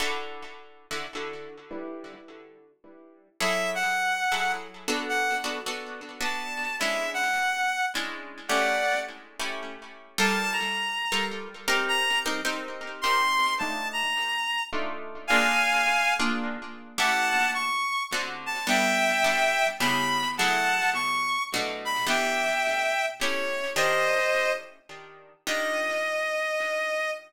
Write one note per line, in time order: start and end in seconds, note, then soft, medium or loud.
0.00 0.43 D3 loud
0.00 0.43 E4 medium
0.00 0.43 F#4 medium
0.00 0.43 A4 loud
0.91 1.06 D3 medium
0.91 1.06 E4 medium
0.91 1.06 F#4 medium
0.91 1.06 A4 medium
1.15 1.59 D3 medium
1.15 1.59 E4 medium
1.15 1.59 F#4 medium
1.15 1.59 A4 medium
1.71 2.14 G3 medium
1.71 2.14 D4 medium
1.71 2.14 E4 loud
1.71 2.14 B4 medium
3.40 3.84 F#3 medium
3.40 3.84 E4 loud
3.40 3.84 G#4 loud
3.40 3.84 A4 loud
3.40 3.70 E5 loud
3.75 4.52 F#5 loud
4.32 4.67 F#3 medium
4.32 4.67 E4 medium
4.32 4.67 G#4 medium
4.32 4.67 A4 medium
4.88 5.34 B3 medium
4.88 5.34 D4 loud
4.88 5.34 F#4 medium
4.88 5.34 A4 loud
5.09 5.37 F#5 loud
5.44 5.59 B3 medium
5.44 5.59 D4 medium
5.44 5.59 F#4 medium
5.44 5.59 A4 medium
5.66 6.10 B3 medium
5.66 6.10 D4 medium
5.66 6.10 F#4 medium
5.66 6.10 A4 medium
6.21 6.64 B3 medium
6.21 6.64 D4 medium
6.21 6.64 F#4 medium
6.21 6.64 A4 medium
6.21 6.76 A5 medium
6.80 7.24 G#3 loud
6.80 7.24 C#4 loud
6.80 7.24 D4 medium
6.80 7.24 E4 loud
6.80 7.10 E5 loud
7.14 7.85 F#5 loud
7.95 8.39 G#3 medium
7.95 8.39 C#4 medium
7.95 8.39 D4 medium
7.95 8.39 E4 medium
8.48 8.93 A3 loud
8.48 8.93 C#4 loud
8.48 8.93 E4 medium
8.48 8.93 G4 loud
8.48 8.99 D5 medium
8.48 8.99 F#5 loud
9.40 9.75 A3 medium
9.40 9.75 C#4 medium
9.40 9.75 E4 medium
9.40 9.75 G4 medium
10.18 10.62 G3 loud
10.18 10.62 F4 loud
10.18 10.62 A4 loud
10.18 10.62 A#4 loud
10.18 10.53 A5 loud
10.53 11.25 A#5 medium
11.12 11.48 G3 medium
11.12 11.48 F4 loud
11.12 11.48 A4 loud
11.12 11.48 A#4 loud
11.68 12.14 C4 loud
11.68 12.14 D#4 loud
11.68 12.14 G4 loud
11.68 12.14 A#4 loud
11.88 12.19 A#5 loud
12.26 12.41 C4 loud
12.26 12.41 D#4 loud
12.26 12.41 G4 loud
12.26 12.41 A#4 loud
12.45 12.88 C4 loud
12.45 12.88 D#4 loud
12.45 12.88 G4 loud
12.45 12.88 A#4 loud
13.01 13.47 C4 loud
13.01 13.47 D#4 loud
13.01 13.47 G4 loud
13.01 13.47 A#4 loud
13.01 13.54 C6 loud
13.59 14.04 A3 loud
13.59 14.04 D4 loud
13.59 14.04 D#4 loud
13.59 14.04 F4 loud
13.59 13.88 A5 loud
13.93 14.63 A#5 loud
14.73 15.16 A3 loud
14.73 15.16 D4 loud
14.73 15.16 D#4 loud
14.73 15.16 F4 loud
15.27 15.74 A#3 loud
15.27 15.74 D4 loud
15.27 15.74 F4 loud
15.27 15.74 G#4 loud
15.27 16.14 F5 loud
15.27 16.14 G#5 loud
16.19 16.55 A#3 loud
16.19 16.55 D4 loud
16.19 16.55 F4 loud
16.19 16.55 G#4 medium
16.98 17.42 A3 loud
16.98 17.42 C#4 loud
16.98 17.42 E4 loud
16.98 17.42 G4 loud
16.98 17.50 F#5 loud
16.98 17.50 A5 loud
17.54 18.03 C#6 loud
18.13 18.56 D3 loud
18.13 18.56 C4 medium
18.13 18.56 F#4 loud
18.13 18.56 A4 medium
18.46 18.66 A5 loud
18.67 19.10 G3 loud
18.67 19.10 B3 loud
18.67 19.10 D4 medium
18.67 19.10 A4 medium
18.67 19.67 E5 loud
18.67 19.67 G5 loud
19.24 19.68 G3 medium
19.24 19.68 B3 medium
19.24 19.68 D4 medium
19.24 19.68 A4 medium
19.80 20.24 C#3 loud
19.80 20.24 B3 loud
19.80 20.24 E4 loud
19.80 20.24 G4 loud
19.80 20.28 B5 loud
20.38 20.83 F#3 loud
20.38 20.83 A3 loud
20.38 20.83 E4 loud
20.38 20.83 G#4 loud
20.38 20.90 F#5 loud
20.38 20.90 A5 loud
20.94 21.43 C#6 loud
21.54 21.97 B2 loud
21.54 21.97 A3 loud
21.54 21.97 D4 loud
21.54 21.97 F#4 loud
21.85 22.05 B5 loud
22.07 22.50 E3 medium
22.07 22.50 B3 loud
22.07 22.50 D4 loud
22.07 22.50 G4 medium
22.07 23.06 E5 medium
22.07 23.06 G5 loud
23.21 23.65 A3 medium
23.21 23.65 C#4 loud
23.21 23.65 E4 loud
23.21 23.65 G4 loud
23.21 23.70 C#5 medium
23.76 24.20 D#3 loud
23.76 24.20 D4 loud
23.76 24.20 F4 loud
23.76 24.20 G4 loud
23.76 24.52 C5 loud
23.76 24.52 D#5 loud
25.47 27.10 D#3 medium
25.47 27.10 D4 loud
25.47 27.10 F4 medium
25.47 27.10 G4 medium
25.47 27.11 D#5 loud